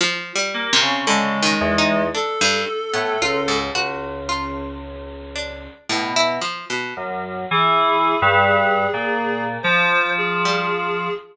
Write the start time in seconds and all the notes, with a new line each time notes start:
0.01 F3
0.35 G3
0.54 A#3
0.73 C3
0.81 C#3
1.07 D3 G#3
1.42 D#3
1.61 E2
1.78 D#4
2.15 D4 A4
2.41 G2
2.94 A2 B3
3.21 C#2 F4
3.48 G#2
3.75 C#2 F#4
4.29 F4
5.35 D4
5.89 A2 B2
6.16 E4
6.42 F3
6.70 B2
6.97 F#2
7.51 E3 G#4
8.22 G2
8.93 A#2
9.63 F3 C5
10.18 G#4
10.45 G3